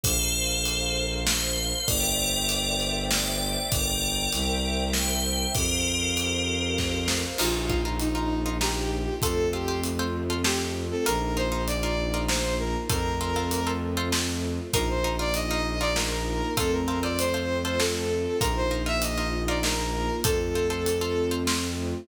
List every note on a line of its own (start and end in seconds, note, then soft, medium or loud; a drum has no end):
0.03 1.72 A#1 medium
0.03 1.02 A4 medium
0.03 1.86 A#4 medium
0.03 1.02 C5 loud
0.03 1.86 C5 medium
0.03 1.86 F5 medium
0.03 kick loud
0.03 closed hi-hat loud
0.65 closed hi-hat loud
1.26 1.86 C5 medium
1.26 snare loud
1.88 3.57 G1 medium
1.88 2.89 A#4 loud
1.88 3.70 C5 medium
1.88 2.89 D5 loud
1.88 3.70 D5 medium
1.88 3.70 E5 medium
1.88 3.70 G5 medium
1.88 kick loud
1.88 closed hi-hat loud
2.49 closed hi-hat loud
2.80 closed hi-hat medium
3.10 3.63 D5 medium
3.10 snare loud
3.71 4.27 G1 medium
3.71 4.82 A#4 medium
3.71 4.32 A#4 medium
3.71 4.82 D5 medium
3.71 4.32 D5 medium
3.71 4.32 G5 medium
3.71 kick loud
3.71 closed hi-hat loud
4.32 5.46 C2 medium
4.32 5.54 A#4 medium
4.32 5.54 C5 medium
4.32 5.54 E5 medium
4.32 5.54 G5 medium
4.32 closed hi-hat loud
4.93 5.48 C5 medium
4.93 snare loud
5.54 7.24 F2 medium
5.54 7.01 G4 medium
5.54 7.37 A#4 medium
5.54 7.01 A#4 medium
5.54 7.37 C5 medium
5.54 7.37 F5 medium
5.54 kick loud
5.54 closed hi-hat loud
6.17 closed hi-hat loud
6.78 kick medium
6.78 snare medium
7.08 snare loud
7.38 9.08 A#1 medium
7.38 9.21 A#3 medium
7.38 9.21 D#4 medium
7.38 7.64 D#4 loud
7.38 9.21 F4 medium
7.38 7.90 F4 medium
7.38 7.64 F4 loud
7.38 7.64 A#4 medium
7.38 crash loud
7.70 7.82 D#4 medium
7.70 7.82 F4 medium
7.70 7.82 A#4 medium
7.70 kick loud
7.85 8.10 D#4 medium
7.85 8.10 F4 medium
7.85 8.10 A#4 medium
7.99 8.49 D#4 medium
7.99 closed hi-hat loud
8.15 8.39 D#4 medium
8.15 8.39 F4 medium
8.15 8.39 A#4 medium
8.46 8.58 D#4 loud
8.46 8.58 F4 medium
8.46 8.58 A#4 medium
8.61 9.10 D#4 loud
8.61 9.10 F4 loud
8.61 9.13 G4 medium
8.61 9.10 A#4 loud
8.61 snare loud
9.22 10.92 F2 medium
9.22 11.04 A3 medium
9.22 11.04 C4 medium
9.22 11.04 F4 medium
9.22 9.47 F4 loud
9.22 9.49 A4 medium
9.22 9.47 A4 loud
9.22 9.47 C5 loud
9.22 kick loud
9.22 closed hi-hat loud
9.53 9.65 F4 medium
9.53 9.80 G4 medium
9.53 9.65 A4 medium
9.53 9.65 C5 medium
9.68 9.92 F4 medium
9.68 9.92 A4 medium
9.68 9.92 C5 loud
9.83 closed hi-hat loud
9.99 10.24 F4 medium
9.99 10.24 A4 medium
9.99 10.24 C5 loud
10.30 10.42 F4 medium
10.30 10.42 A4 medium
10.30 10.42 C5 medium
10.44 10.94 F4 medium
10.44 10.73 G4 medium
10.44 10.94 A4 medium
10.44 10.94 C5 loud
10.44 snare loud
10.91 11.05 A4 medium
11.06 12.75 A#1 medium
11.06 12.88 A#3 medium
11.06 11.30 D#4 loud
11.06 12.88 D#4 medium
11.06 11.30 F4 loud
11.06 12.88 F4 medium
11.06 11.30 A#4 loud
11.06 11.32 A#4 medium
11.06 closed hi-hat loud
11.37 11.49 D#4 medium
11.37 11.49 F4 medium
11.37 11.49 A#4 medium
11.37 11.61 C5 medium
11.52 11.76 D#4 loud
11.52 11.76 F4 medium
11.52 11.76 A#4 medium
11.67 12.17 D5 medium
11.67 closed hi-hat loud
11.83 12.08 D#4 medium
11.83 12.08 F4 loud
11.83 12.08 A#4 medium
12.14 12.26 D#4 medium
12.14 12.26 F4 medium
12.14 12.26 A#4 loud
12.28 12.77 D#4 medium
12.28 12.77 F4 medium
12.28 12.77 A#4 medium
12.28 12.55 C5 medium
12.28 snare loud
12.59 12.74 A#4 medium
12.89 14.59 F2 medium
12.89 14.72 A3 medium
12.89 14.72 C4 medium
12.89 13.14 F4 loud
12.89 14.72 F4 medium
12.89 13.14 A4 loud
12.89 13.68 A#4 medium
12.89 13.14 C5 loud
12.89 kick loud
12.89 closed hi-hat loud
13.21 13.33 F4 loud
13.21 13.33 A4 medium
13.21 13.33 C5 medium
13.36 13.60 F4 loud
13.36 13.60 A4 loud
13.36 13.60 C5 medium
13.51 closed hi-hat loud
13.67 13.91 F4 medium
13.67 13.91 A4 loud
13.67 13.91 C5 medium
13.97 14.09 F4 loud
13.97 14.09 A4 loud
13.97 14.09 C5 loud
14.12 14.61 F4 medium
14.12 14.61 A4 medium
14.12 14.61 C5 medium
14.12 snare loud
14.73 16.42 A#1 medium
14.73 16.55 A#3 medium
14.73 16.55 D#4 medium
14.73 14.98 D#4 loud
14.73 16.55 F4 medium
14.73 14.98 F4 loud
14.73 14.88 A#4 loud
14.73 14.98 A#4 loud
14.73 kick loud
14.73 closed hi-hat loud
14.89 15.17 C5 medium
15.04 15.16 D#4 loud
15.04 15.16 F4 loud
15.04 15.16 A#4 loud
15.19 15.44 D#4 medium
15.19 15.44 F4 loud
15.19 15.44 A#4 medium
15.19 15.34 D5 medium
15.34 15.79 D#5 medium
15.34 closed hi-hat loud
15.51 15.75 D#4 loud
15.51 15.75 F4 loud
15.51 15.75 A#4 medium
15.80 15.93 D#4 loud
15.80 15.93 F4 medium
15.80 15.93 A#4 medium
15.80 15.95 D5 medium
15.96 16.45 D#4 medium
15.96 16.45 F4 medium
15.96 16.54 A#4 medium
15.96 16.45 A#4 loud
15.96 snare loud
16.57 18.26 F2 medium
16.57 18.39 A3 medium
16.57 18.39 C4 medium
16.57 16.82 F4 loud
16.57 18.39 F4 medium
16.57 16.82 A4 loud
16.57 16.72 A4 loud
16.57 16.82 C5 loud
16.57 kick loud
16.57 closed hi-hat loud
16.72 16.98 A#4 medium
16.88 17.00 F4 loud
16.88 17.00 A4 loud
16.88 17.00 C5 loud
17.03 17.27 F4 medium
17.03 17.27 A4 loud
17.03 17.27 C5 loud
17.03 17.17 D5 medium
17.18 17.58 C5 medium
17.18 closed hi-hat loud
17.34 17.58 F4 loud
17.34 17.58 A4 medium
17.34 17.58 C5 medium
17.64 17.77 F4 medium
17.64 17.77 A4 loud
17.64 17.79 C5 medium
17.64 17.77 C5 loud
17.80 18.29 F4 loud
17.80 18.29 A4 loud
17.80 18.36 A4 medium
17.80 18.29 C5 medium
17.80 snare loud
18.41 20.10 A#1 medium
18.41 20.23 A#3 medium
18.41 18.65 D#4 loud
18.41 20.23 D#4 medium
18.41 18.65 F4 loud
18.41 20.23 F4 medium
18.41 18.55 A#4 medium
18.41 18.65 A#4 loud
18.41 kick loud
18.41 closed hi-hat loud
18.56 18.82 C5 medium
18.71 18.83 D#4 medium
18.71 18.83 F4 medium
18.71 18.83 A#4 medium
18.86 19.11 D#4 loud
18.86 19.11 F4 medium
18.86 19.11 A#4 loud
18.86 19.01 E5 medium
19.02 19.39 D#5 medium
19.02 closed hi-hat loud
19.17 19.42 D#4 loud
19.17 19.42 F4 medium
19.17 19.42 A#4 loud
19.48 19.60 D#4 loud
19.48 19.60 F4 loud
19.48 19.60 A#4 loud
19.48 19.63 D5 medium
19.63 20.12 D#4 loud
19.63 20.12 F4 medium
19.63 20.12 A#4 loud
19.63 20.16 A#4 medium
19.63 snare loud
20.24 21.94 F2 medium
20.24 22.06 A3 medium
20.24 22.06 C4 medium
20.24 22.06 F4 medium
20.24 20.49 F4 loud
20.24 21.30 A4 medium
20.24 20.49 A4 loud
20.24 20.49 C5 loud
20.24 kick loud
20.24 closed hi-hat loud
20.55 20.68 F4 loud
20.55 20.68 A4 medium
20.55 20.68 C5 loud
20.70 20.95 F4 medium
20.70 20.95 A4 loud
20.70 20.95 C5 loud
20.86 closed hi-hat loud
21.01 21.26 F4 loud
21.01 21.26 A4 loud
21.01 21.26 C5 loud
21.31 21.43 F4 loud
21.31 21.43 A4 loud
21.31 21.43 C5 loud
21.47 21.96 F4 loud
21.47 21.96 A4 medium
21.47 21.96 C5 medium
21.47 snare loud